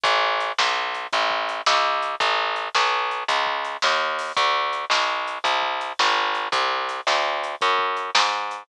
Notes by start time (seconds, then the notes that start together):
0.03 A1, kick, closed hi-hat
0.40 closed hi-hat
0.58 B1, snare
0.94 closed hi-hat
1.13 A1, kick, closed hi-hat
1.30 kick
1.49 closed hi-hat
1.66 C#2, snare
2.02 closed hi-hat
2.20 A1, kick, closed hi-hat
2.56 closed hi-hat
2.75 B1, snare
3.11 closed hi-hat
3.28 C#2, kick, closed hi-hat
3.47 kick
3.65 closed hi-hat
3.82 D#2, snare
4.19 open hi-hat
4.37 D2, kick, closed hi-hat
4.73 closed hi-hat
4.90 B1, snare
5.27 closed hi-hat
5.44 C2, kick, closed hi-hat
5.63 kick
5.81 closed hi-hat
5.99 G#1, snare
6.35 closed hi-hat
6.52 C2, kick, closed hi-hat
6.89 closed hi-hat
7.07 D2, snare
7.44 closed hi-hat
7.61 F#2, kick, closed hi-hat
7.79 kick
7.97 closed hi-hat
8.15 G#2, snare
8.51 closed hi-hat